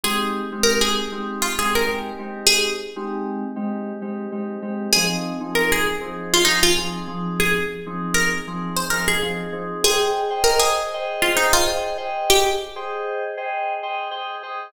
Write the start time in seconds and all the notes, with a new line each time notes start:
0.04 G#3 C4 D#4 G4 G#4
0.52 G#3 C4 D#4 G4
0.63 A#4
0.81 G#4
1.12 G#3 C4 D#4 G4
1.42 F4
1.58 G#3 C4 D#4 G4 G#4
1.75 A#4
1.86 G#3 C4 D#4 G4
2.18 G#3 C4 D#4 G4
2.47 G#4
2.96 G#3 C4 D#4 G4
3.56 G#3 C4 D#4 G4
4.02 G#3 C4 D#4 G4
4.32 G#3 C4 D#4 G4
4.62 G#3 C4 D#4 G4
4.93 F3 C4 D#4 G#4
5.40 F3 C4 D#4 G#4
5.55 A#4
5.72 G#4
6.01 F3 C4 D#4 G#4
6.34 F4
6.45 F3 C4 D#4 G#4
6.63 F4
6.77 F3 C4 D#4 G#4
7.07 F3 C4 D#4 G#4
7.40 G#4
7.86 F3 C4 D#4 G#4
8.14 A#4
8.47 F3 C4 D#4 G#4
8.76 C5
8.90 F3 C4 D#4 G#4 A#4
9.08 G#4
9.22 F3 C4 D#4 G#4
9.52 F3 C4 D#4 G#4
9.84 G#4 C5 D#5 G5
10.30 G#4 C5 D#5 G5
10.44 A#4
10.59 G#4
10.94 G#4 C5 D#5 G5
11.22 F4
11.35 D#4 G#4 C5 D#5 G5
11.53 F4
11.67 G#4 C5 D#5 G5
11.97 G#4 C5 D#5 G5
12.30 G4
12.76 G#4 C5 D#5 G5
13.37 G#4 C5 D#5 G5
13.83 G#4 C5 D#5 G5
14.11 G#4 C5 D#5 G5
14.43 G#4 C5 D#5 G5